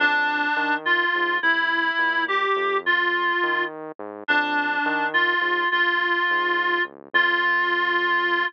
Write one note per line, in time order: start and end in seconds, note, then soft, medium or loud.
0.00 0.48 F2 medium
0.00 0.75 D4 loud
0.57 1.05 D#3 medium
0.85 1.37 F4 medium
1.15 1.39 G#2 medium
1.42 1.91 C2 loud
1.42 2.24 E4 medium
1.98 2.47 A#2 medium
2.28 2.77 G4 medium
2.56 3.33 F2 medium
2.86 3.64 F4 medium
3.43 3.92 D#3 medium
3.99 4.24 G#2 medium
4.28 4.78 F2 loud
4.28 5.06 D4 medium
4.86 5.34 D#3 medium
5.14 5.68 F4 medium
5.41 5.65 G#2 medium
5.71 6.20 A#1 medium
5.71 6.82 F4 medium
6.30 6.79 G#2 medium
6.85 7.09 C#2 medium
7.13 8.44 F2 loud
7.13 8.45 F4 loud